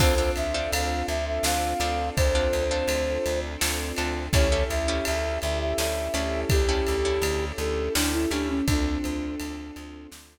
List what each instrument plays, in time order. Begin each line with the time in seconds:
0.00 electric bass (finger) D2, orchestral harp C4 D4 F4 A4, string ensemble 1 C4 D4 F4 A4, flute C5, kick, crash
0.18 orchestral harp C4 D4 F4 A4
0.36 electric bass (finger) D2, flute E5, ride
0.54 orchestral harp C4 D4 F4 A4
0.72 electric bass (finger) D2, flute F5, ride
1.08 electric bass (finger) D2, flute E5, ride
1.27 flute E5
1.43 electric bass (finger) D2, orchestral harp C4 D4 F4 A4, flute F5, snare
1.80 electric bass (finger) D2, orchestral harp C4 D4 F4 A4, ride
2.16 electric bass (finger) D2, flute C5, kick, ride
2.35 orchestral harp C4 D4 F4 A4
2.53 electric bass (finger) D2, ride
2.71 orchestral harp C4 D4 F4 A4
2.88 electric bass (finger) D2, ride
3.26 electric bass (finger) D2, ride
3.61 electric bass (finger) D2, orchestral harp C4 D4 F4 A4, snare
3.97 electric bass (finger) D2, orchestral harp C4 D4 F4 A4, ride
4.33 electric bass (finger) D2, orchestral harp C#4 E4 G4 A4, string ensemble 1 C#4 E4 G4 A4, flute C#5, kick, ride
4.52 orchestral harp C#4 E4 G4 A4
4.70 electric bass (finger) D2, flute E5, ride
4.88 orchestral harp C#4 E4 G4 A4
5.05 electric bass (finger) D2, flute E5, ride
5.42 electric bass (finger) D2, flute E5, ride
5.61 flute E5
5.78 electric bass (finger) D2, orchestral harp C#4 E4 G4 A4, flute E5, snare
6.14 electric bass (finger) D2, orchestral harp C#4 E4 G4 A4, ride
6.50 electric bass (finger) D2, flute G4, kick, ride
6.69 orchestral harp C#4 E4 G4 A4
6.87 electric bass (finger) D2, ride
7.05 orchestral harp C#4 E4 G4 A4
7.22 electric bass (finger) D2, ride
7.58 electric bass (finger) D2, flute A4, ride
7.95 electric bass (finger) D2, orchestral harp C#4 E4 G4 A4, flute D4, snare
8.13 flute E4
8.31 electric bass (finger) D2, orchestral harp C#4 E4 G4 A4, flute D4, ride
8.49 flute C#4
8.67 electric bass (finger) D2, string ensemble 1 C4 D4 F4 A4, flute D4, kick, ride
9.04 electric bass (finger) D2, ride
9.40 electric bass (finger) D2, ride
9.76 electric bass (finger) D2, ride
10.12 electric bass (finger) D2, snare